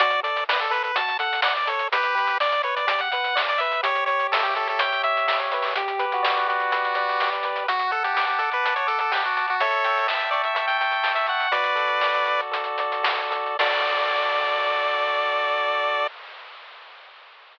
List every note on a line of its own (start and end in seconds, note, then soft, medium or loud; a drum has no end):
0.00 0.88 D2 medium
0.00 0.22 F#4 loud
0.00 0.20 D5 loud
0.00 kick loud
0.00 closed hi-hat loud
0.10 closed hi-hat medium
0.23 0.45 A4 medium
0.23 0.44 D5 medium
0.23 closed hi-hat medium
0.36 closed hi-hat medium
0.49 0.60 B4 medium
0.49 0.70 D5 medium
0.49 snare loud
0.60 0.73 A4 medium
0.60 closed hi-hat medium
0.70 0.92 A4 medium
0.70 0.83 B4 loud
0.70 closed hi-hat medium
0.83 0.96 B4 medium
0.83 closed hi-hat medium
0.96 1.84 D2 medium
0.96 1.17 F#4 medium
0.96 1.18 A5 medium
0.96 kick medium
0.96 closed hi-hat loud
1.08 closed hi-hat medium
1.19 1.41 A4 medium
1.19 1.41 F#5 medium
1.19 closed hi-hat medium
1.33 closed hi-hat medium
1.42 1.65 D5 medium
1.42 1.54 F#5 loud
1.42 snare loud
1.57 1.69 D5 medium
1.57 closed hi-hat medium
1.67 1.89 A4 medium
1.67 1.88 C#5 medium
1.67 closed hi-hat medium
1.79 closed hi-hat medium
1.92 2.80 G1 medium
1.92 2.15 G4 loud
1.92 2.38 G4 medium
1.92 2.38 B4 loud
1.92 kick loud
1.92 closed hi-hat loud
2.03 closed hi-hat medium
2.15 2.37 B4 medium
2.15 closed hi-hat medium
2.27 closed hi-hat medium
2.40 2.62 D5 medium
2.40 2.62 D5 loud
2.40 snare loud
2.52 closed hi-hat medium
2.63 2.86 B4 medium
2.63 2.75 C#5 medium
2.63 closed hi-hat medium
2.76 2.88 D5 medium
2.76 closed hi-hat medium
2.87 3.77 G1 medium
2.87 3.09 G4 medium
2.87 3.01 D5 loud
2.87 kick medium
2.87 closed hi-hat loud
2.99 3.11 F#5 medium
2.99 closed hi-hat medium
3.11 3.35 B4 medium
3.11 3.42 F#5 loud
3.11 closed hi-hat medium
3.24 closed hi-hat medium
3.35 3.57 D5 medium
3.35 snare loud
3.49 3.60 D5 loud
3.49 closed hi-hat medium
3.58 3.82 B4 medium
3.58 3.81 E5 loud
3.58 closed hi-hat medium
3.72 closed hi-hat medium
3.83 4.73 C#2 medium
3.83 4.56 G4 loud
3.83 4.04 C#5 loud
3.83 kick loud
3.83 closed hi-hat loud
3.95 closed hi-hat medium
4.06 4.27 C#5 loud
4.06 4.80 C#5 medium
4.06 closed hi-hat medium
4.20 closed hi-hat medium
4.32 4.43 A4 loud
4.32 5.04 E5 medium
4.32 snare loud
4.43 4.54 G4 loud
4.43 closed hi-hat medium
4.55 5.27 G4 medium
4.55 4.68 A4 loud
4.55 closed hi-hat medium
4.67 4.81 A4 medium
4.67 closed hi-hat medium
4.79 5.68 C#2 medium
4.79 5.51 C#5 medium
4.79 5.02 G5 loud
4.79 kick medium
4.79 closed hi-hat loud
4.92 closed hi-hat medium
5.03 5.27 E5 medium
5.03 5.73 E5 medium
5.03 closed hi-hat medium
5.17 closed hi-hat medium
5.27 5.73 G4 medium
5.27 5.39 E5 loud
5.27 snare loud
5.40 5.51 C#5 medium
5.40 closed hi-hat medium
5.52 5.75 B4 medium
5.52 5.75 C#5 medium
5.52 closed hi-hat medium
5.62 open hi-hat medium
5.75 6.64 G1 medium
5.75 6.05 G4 loud
5.75 6.47 G4 loud
5.75 kick loud
5.75 closed hi-hat loud
5.88 closed hi-hat medium
5.99 6.72 B4 medium
5.99 closed hi-hat medium
6.12 6.48 F#4 loud
6.12 closed hi-hat medium
6.23 6.95 D5 medium
6.23 snare loud
6.37 closed hi-hat medium
6.48 7.30 F#4 medium
6.48 7.20 G4 medium
6.48 closed hi-hat medium
6.60 closed hi-hat medium
6.72 7.18 G1 medium
6.72 7.44 B4 medium
6.72 kick medium
6.72 closed hi-hat loud
6.84 closed hi-hat medium
6.95 7.64 D5 medium
6.95 closed hi-hat medium
7.09 closed hi-hat medium
7.20 7.42 C2 medium
7.20 7.66 G4 loud
7.20 snare loud
7.33 closed hi-hat medium
7.43 7.66 C#2 medium
7.43 7.67 B4 medium
7.43 closed hi-hat medium
7.56 closed hi-hat medium
7.68 8.56 D2 medium
7.68 7.91 F#4 loud
7.68 8.39 F#5 loud
7.68 kick loud
7.68 closed hi-hat medium
7.79 closed hi-hat medium
7.91 8.03 A4 medium
7.91 8.64 A5 medium
7.91 closed hi-hat medium
8.04 8.14 G4 medium
8.04 closed hi-hat medium
8.14 8.26 G4 medium
8.14 8.86 D6 medium
8.14 snare loud
8.27 8.40 G4 medium
8.27 closed hi-hat medium
8.38 8.50 A4 medium
8.38 9.11 F#5 medium
8.38 closed hi-hat medium
8.52 8.74 B4 medium
8.52 closed hi-hat medium
8.64 9.52 D2 medium
8.64 9.36 A5 medium
8.64 kick medium
8.64 closed hi-hat loud
8.76 8.87 C#5 medium
8.76 closed hi-hat medium
8.87 8.99 A4 loud
8.87 9.55 D6 medium
8.87 closed hi-hat medium
8.99 9.12 A4 medium
8.99 closed hi-hat medium
9.11 9.23 G4 medium
9.11 9.57 F#5 medium
9.11 snare loud
9.22 9.46 F#4 medium
9.22 closed hi-hat medium
9.37 9.59 A5 medium
9.37 closed hi-hat medium
9.48 9.61 F#4 medium
9.48 closed hi-hat medium
9.60 10.48 A1 medium
9.60 10.07 A4 medium
9.60 10.07 C#5 loud
9.60 10.55 E5 loud
9.60 kick loud
9.60 closed hi-hat loud
9.71 closed hi-hat medium
9.84 10.80 G5 medium
9.84 closed hi-hat medium
9.98 closed hi-hat medium
10.08 10.30 E5 medium
10.08 11.03 A5 medium
10.08 snare loud
10.20 closed hi-hat medium
10.31 10.42 D5 medium
10.31 11.28 C#6 medium
10.31 closed hi-hat medium
10.44 10.54 E5 medium
10.44 closed hi-hat medium
10.54 11.44 A1 medium
10.54 10.66 E5 medium
10.54 11.47 E5 medium
10.54 kick medium
10.54 closed hi-hat loud
10.68 10.78 G5 medium
10.68 closed hi-hat medium
10.78 11.12 G5 medium
10.78 11.49 G5 medium
10.78 closed hi-hat medium
10.91 closed hi-hat medium
11.03 11.49 A5 medium
11.03 snare loud
11.15 11.27 E5 medium
11.15 closed hi-hat medium
11.27 11.52 F#5 medium
11.27 11.51 C#6 medium
11.27 closed hi-hat medium
11.40 closed hi-hat medium
11.52 12.44 D2 medium
11.52 12.25 F#4 loud
11.52 12.41 B4 medium
11.52 12.41 D5 loud
11.52 kick medium
11.52 closed hi-hat loud
11.64 closed hi-hat medium
11.75 12.51 A4 medium
11.75 closed hi-hat medium
11.87 closed hi-hat medium
12.01 12.79 D5 medium
12.01 snare loud
12.14 closed hi-hat medium
12.25 13.03 F#4 medium
12.25 closed hi-hat medium
12.39 closed hi-hat medium
12.51 13.51 D2 medium
12.51 13.30 A4 medium
12.51 kick medium
12.51 closed hi-hat loud
12.64 closed hi-hat medium
12.78 13.57 D5 medium
12.78 closed hi-hat medium
12.92 closed hi-hat medium
13.03 13.56 F#4 medium
13.03 snare loud
13.19 closed hi-hat medium
13.30 13.57 A4 medium
13.30 closed hi-hat medium
13.46 closed hi-hat medium
13.59 16.07 D2 medium
13.59 16.07 F#4 loud
13.59 16.07 A4 medium
13.59 16.07 D5 medium
13.59 16.07 D5 loud
13.59 kick loud
13.59 crash loud